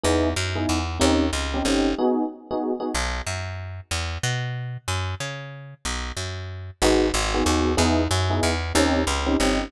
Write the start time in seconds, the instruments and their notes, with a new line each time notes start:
0.03 electric bass (finger) E2, electric piano 1 B3 D#4 E4 G#4
0.36 electric bass (finger) F#2
0.55 electric piano 1 B3 D#4 E4 G#4
0.69 electric bass (finger) E2
1.00 electric bass (finger) D#2, electric piano 1 C4 C#4 D#4 G4
1.33 electric bass (finger) C#2
1.54 electric piano 1 C4 C#4 D#4 G4
1.65 electric bass (finger) G1, electric piano 1 C4 C#4 D#4 G4
1.98 electric piano 1 B3 D#4 F#4 G#4
2.51 electric piano 1 B3 D#4 F#4 G#4
2.80 electric piano 1 B3 D#4 F#4 G#4
2.94 electric bass (finger) B1
3.27 electric bass (finger) F#2
3.91 electric bass (finger) E2
4.23 electric bass (finger) B2
4.88 electric bass (finger) F#2
5.20 electric bass (finger) C#3
5.85 electric bass (finger) B1
6.17 electric bass (finger) F#2
6.82 electric bass (finger) G#1, electric piano 1 B3 D#4 F#4 G#4
7.14 electric bass (finger) G#1
7.34 electric piano 1 B3 D#4 F#4 G#4
7.45 electric bass (finger) D#2, electric piano 1 B3 D#4 F#4 G#4
7.77 electric bass (finger) E2, electric piano 1 B3 D#4 E4 G#4
8.11 electric bass (finger) F#2
8.30 electric piano 1 B3 D#4 E4 G#4
8.43 electric bass (finger) E2
8.75 electric bass (finger) D#2, electric piano 1 C4 C#4 D#4 G4
9.07 electric bass (finger) C#2
9.26 electric piano 1 C4 C#4 D#4 G4
9.40 electric bass (finger) G1, electric piano 1 C4 C#4 D#4 G4